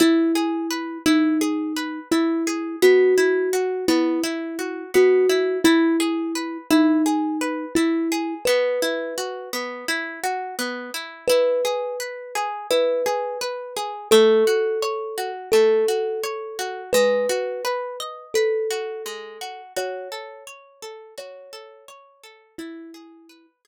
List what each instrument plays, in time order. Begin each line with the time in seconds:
0.00 orchestral harp E4, kalimba E4
0.35 orchestral harp G#4
0.71 orchestral harp B4
1.06 kalimba D#4, orchestral harp E4
1.41 orchestral harp G#4
1.76 orchestral harp B4
2.11 kalimba E4, orchestral harp E4
2.47 orchestral harp G#4
2.82 orchestral harp B3, kalimba F#4
3.18 orchestral harp E4
3.53 orchestral harp F#4
3.88 orchestral harp B3, kalimba E4
4.24 orchestral harp E4
4.59 orchestral harp F#4
4.94 orchestral harp B3, kalimba F#4
5.29 orchestral harp E4
5.64 kalimba E4, orchestral harp E4
6.00 orchestral harp G#4
6.35 orchestral harp B4
6.71 kalimba D#4, orchestral harp E4
7.06 orchestral harp G#4
7.41 orchestral harp B4
7.75 kalimba E4, orchestral harp E4
8.12 orchestral harp G#4
8.45 orchestral harp B3, kalimba B4
8.82 orchestral harp E4
9.18 orchestral harp F#4
9.53 orchestral harp B3
9.88 orchestral harp E4
10.24 orchestral harp F#4
10.59 orchestral harp B3
10.94 orchestral harp E4
11.28 orchestral harp E4, kalimba B4
11.65 orchestral harp G#4
12.00 orchestral harp B4
12.35 orchestral harp G#4
12.71 orchestral harp E4, kalimba B4
13.06 orchestral harp G#4
13.41 orchestral harp B4
13.76 orchestral harp G#4
14.11 orchestral harp A3, kalimba A4
14.47 orchestral harp F#4
14.82 orchestral harp C#5
15.18 orchestral harp F#4
15.52 orchestral harp A3, kalimba A4
15.88 orchestral harp F#4
16.24 orchestral harp C#5
16.59 orchestral harp F#4
16.93 orchestral harp G#3, kalimba B4
17.29 orchestral harp F#4
17.65 orchestral harp B4
18.00 orchestral harp D#5
18.34 kalimba A4, orchestral harp B4
18.70 orchestral harp F#4
19.06 orchestral harp G#3
19.41 orchestral harp F#4
19.76 orchestral harp F#4, kalimba C#5
20.12 orchestral harp A4
20.47 orchestral harp C#5
20.82 orchestral harp A4
21.18 orchestral harp F#4, kalimba C#5
21.53 orchestral harp A4
21.88 orchestral harp C#5
22.24 orchestral harp A4
22.58 kalimba E4, orchestral harp E4
22.94 orchestral harp G#4
23.29 orchestral harp B4
23.65 orchestral harp G#4